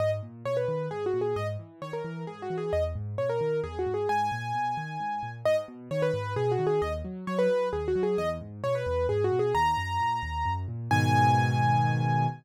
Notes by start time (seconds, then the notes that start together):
0.00 G#2 D#5
0.23 A#2
0.45 B2 C#5
0.57 B4
0.68 D#3
0.91 G#2 G#4
1.06 F#4
1.14 A#2
1.21 G#4
1.36 G#2 D#5
1.59 E3
1.82 D#3 C#5
1.93 A#4
2.05 E3
2.27 G#2 G#4
2.42 F#4
2.50 E3
2.58 G#4
2.73 E2 D#5
2.95 G#2
3.18 B2 C#5
3.29 A#4
3.41 D#3
3.64 E2 G#4
3.79 F#4
3.86 G#2
3.94 G#4
4.09 G#2 G#5
4.32 A#2
4.55 B2
4.77 D#3
5.00 G#2
5.23 A#2
5.45 G#2 D#5
5.68 B2
5.91 D#3 C#5
6.02 B4
6.14 G#2
6.36 B2 G#4
6.52 F#4
6.59 D#3
6.67 G#4
6.82 D#2 D#5
7.05 F#3
7.27 F#3 C#5
7.39 B4
7.50 F#3
7.73 D#2 G#4
7.88 F#4
7.95 F#3
8.03 G#4
8.18 E2 D#5
8.41 G#2
8.64 B2 C#5
8.75 B4
8.86 E2
9.09 G#2 G#4
9.24 F#4
9.32 B2
9.39 G#4
9.55 D#2 A#5
9.77 F#2
10.00 A#2
10.23 D#2
10.45 F#2
10.68 A#2
10.91 G#2 B2 D#3 G#5